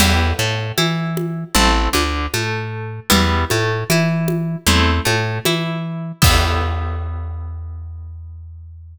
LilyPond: <<
  \new Staff \with { instrumentName = "Acoustic Guitar (steel)" } { \time 4/4 \key e \minor \tempo 4 = 77 <b e' g'>8 a8 e'4 <a c' e'>8 d8 a4 | <g b e'>8 a8 e'4 <a c' e'>8 a8 e'4 | <b e' g'>1 | }
  \new Staff \with { instrumentName = "Electric Bass (finger)" } { \clef bass \time 4/4 \key e \minor e,8 a,8 e4 a,,8 d,8 a,4 | e,8 a,8 e4 e,8 a,8 e4 | e,1 | }
  \new DrumStaff \with { instrumentName = "Drums" } \drummode { \time 4/4 <cgl cymc>4 cgho8 cgho8 cgl8 cgho8 cgho4 | cgl8 cgho8 cgho8 cgho8 cgl8 cgho8 cgho4 | <cymc bd>4 r4 r4 r4 | }
>>